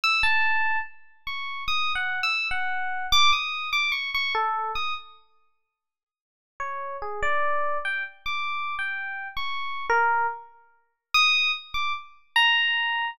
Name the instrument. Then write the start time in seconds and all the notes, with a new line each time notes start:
electric piano 1
0.04 E6
0.23 A5
1.27 C#6
1.68 D#6
1.95 F#5
2.23 E6
2.51 F#5
3.12 D6
3.33 D#6
3.73 D6
3.92 C#6
4.14 C#6
4.35 A4
4.75 D#6
6.60 C#5
7.02 G#4
7.22 D5
7.85 G5
8.26 D6
8.79 G5
9.37 C#6
9.90 A#4
11.14 D#6
11.74 D6
12.36 A#5